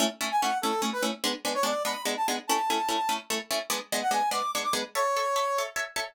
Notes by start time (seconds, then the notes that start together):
0.00 A3 C#4 E4
0.21 A3 C#4 E4
0.31 G#5
0.41 A3 C#4 E4 F#5
0.62 A3 C#4 E4 A4
0.82 A3 C#4 E4
0.93 B4
1.02 A3 C#4 E4
1.24 G#3 B3 D4
1.45 G#3 B3 D4
1.54 C#5
1.63 G#3 B3 D4 D5
1.85 G#3 B3 D4 B5
2.05 G#3 B3 D4
2.17 A5
2.28 G#3 B3 D4
2.47 A3 C#4 E4 A5
2.70 A3 C#4 E4
2.89 A3 C#4 E4
3.09 A3 C#4 E4
3.30 A3 C#4 E4
3.51 A3 C#4 E4
3.70 G#3 B3 D4
3.92 G#3 B3 D4
4.02 F#5
4.11 G#3 B3 D4 G#5
4.31 G#3 B3 D4 D6
4.55 G#3 B3 D4
4.64 D6
4.73 G#3 B3 D4
4.95 A4 C#5 E5
5.16 A4 C#5 E5
5.36 A4 C#5 E5
5.58 A4 C#5 E5
5.76 A4 C#5 E5
5.96 A4 C#5 E5